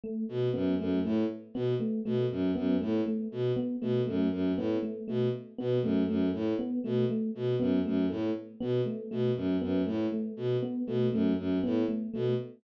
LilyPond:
<<
  \new Staff \with { instrumentName = "Violin" } { \clef bass \time 5/4 \tempo 4 = 119 r8 b,8 ges,8 ges,8 a,8 r8 b,8 r8 b,8 ges,8 | ges,8 a,8 r8 b,8 r8 b,8 ges,8 ges,8 a,8 r8 | b,8 r8 b,8 ges,8 ges,8 a,8 r8 b,8 r8 b,8 | ges,8 ges,8 a,8 r8 b,8 r8 b,8 ges,8 ges,8 a,8 |
r8 b,8 r8 b,8 ges,8 ges,8 a,8 r8 b,8 r8 | }
  \new Staff \with { instrumentName = "Electric Piano 1" } { \time 5/4 a8 r8 b8 a8 a8 r8 b8 a8 a8 r8 | b8 a8 a8 r8 b8 a8 a8 r8 b8 a8 | a8 r8 b8 a8 a8 r8 b8 a8 a8 r8 | b8 a8 a8 r8 b8 a8 a8 r8 b8 a8 |
a8 r8 b8 a8 a8 r8 b8 a8 a8 r8 | }
>>